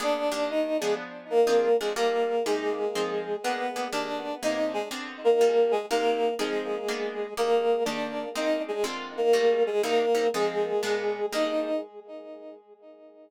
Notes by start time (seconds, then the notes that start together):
0.00 A#3 B3 D4 G#4 D5
0.32 D#3 A#3 D4 G4
0.50 D#4 D#5
0.81 F3 G#3 B3 D4 G#4
1.30 A#3 A#4
1.47 F3 C4 D4 G#4
1.80 F3 G#3 C4 D4 G#4
1.96 G3 A#3 F4 A4 A#4
2.46 C3 G#3 A#3 D#4 G4 G#4
2.95 F3 C4 D#4 G#4
3.43 A#3 B3 D4 G#4 B4
3.76 A#3 B3 D4 G#4
3.92 D#3 A#3 D4 G4 D5
4.43 C3 A#3 D#4 G#4 D#5
4.73 G#3 G#4
4.91 D3 C4 F4 G#4
5.24 A#3 A#4
5.41 G3 A#3 F4 A4
5.71 G#3 G#4
5.90 C3 A#3 D#4 G4 A#4
6.39 F3 G#3 C4 D#4 G#4
6.88 A#3 B3 D4 G#4
7.37 D#3 A#3 D4 G4 A#4
7.85 D#3 A#3 D4 G4 D5
8.35 G#3 A#3 C4 D#4 D#5
8.68 G#3 G#4
8.84 D3 G#3 C4 F4
9.17 A#3 A#4
9.33 G3 A3 A#3 F4
9.67 G#3 G#4
9.83 C3 G3 A#3 D#4 A#4
10.15 C3 G3 A#3 D#4
10.34 F3 G#3 C4 D#4 G#4
10.83 A#2 G#3 B3 D4
11.32 D#3 G3 A#3 D4 D#4 D#5